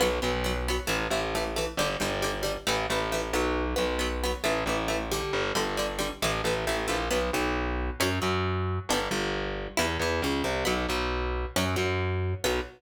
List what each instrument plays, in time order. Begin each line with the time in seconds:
0.00 electric bass (finger) B1, acoustic guitar (steel) F#3 B3
0.22 electric bass (finger) B1, acoustic guitar (steel) F#3 B3
0.44 acoustic guitar (steel) F#3 B3
0.68 acoustic guitar (steel) F#3 B3
0.87 electric bass (finger) A1, acoustic guitar (steel) E3 A3
1.10 electric bass (finger) A1, acoustic guitar (steel) E3 A3
1.35 acoustic guitar (steel) E3 A3
1.56 acoustic guitar (steel) E3 A3
1.77 electric bass (finger) G1, acoustic guitar (steel) D3 G3
2.00 electric bass (finger) G1, acoustic guitar (steel) D3 G3
2.22 acoustic guitar (steel) D3 G3
2.43 acoustic guitar (steel) D3 G3
2.67 electric bass (finger) A1, acoustic guitar (steel) E3 A3
2.90 electric bass (finger) A1, acoustic guitar (steel) E3 A3
3.12 acoustic guitar (steel) E3 A3
3.33 electric bass (finger) B1, acoustic guitar (steel) F#3 B3
3.76 electric bass (finger) B1, acoustic guitar (steel) F#3 B3
3.99 acoustic guitar (steel) F#3 B3
4.24 acoustic guitar (steel) F#3 B3
4.44 electric bass (finger) A1, acoustic guitar (steel) E3 A3
4.66 electric bass (finger) A1, acoustic guitar (steel) E3 A3
4.88 acoustic guitar (steel) E3 A3
5.11 acoustic guitar (steel) D3 G3
5.33 electric bass (finger) G1
5.55 electric bass (finger) G1, acoustic guitar (steel) D3 G3
5.77 acoustic guitar (steel) D3 G3
5.99 acoustic guitar (steel) D3 G3
6.22 electric bass (finger) A1, acoustic guitar (steel) E3 A3
6.44 electric bass (finger) A1, acoustic guitar (steel) E3 A3
6.67 electric bass (finger) A1, acoustic guitar (steel) E3 A3
6.88 electric bass (finger) A#1, acoustic guitar (steel) E3 A3
7.11 electric bass (finger) B1, acoustic guitar (steel) F#3 B3
7.33 electric bass (finger) B1, acoustic guitar (steel) B2
8.00 electric bass (finger) F#2, acoustic guitar (steel) F#3 C#4
8.22 electric bass (finger) F#2, acoustic guitar (steel) F#3
8.89 electric bass (finger) G1, acoustic guitar (steel) B3 D4
8.94 acoustic guitar (steel) G3
9.11 electric bass (finger) G1, acoustic guitar (steel) G2
9.77 electric bass (finger) E2, acoustic guitar (steel) G3 B3 E4
10.00 electric bass (finger) E2, acoustic guitar (steel) E3
10.22 electric bass (finger) C#2, acoustic guitar (steel) C#3
10.44 electric bass (finger) C2, acoustic guitar (steel) C3
10.65 electric bass (finger) B1, acoustic guitar (steel) F#3 B3
10.89 electric bass (finger) B1, acoustic guitar (steel) B2
11.56 electric bass (finger) F#2, acoustic guitar (steel) F#3 C#4
11.76 electric bass (finger) F#2, acoustic guitar (steel) F#3
12.44 electric bass (finger) B1, acoustic guitar (steel) F#3 B3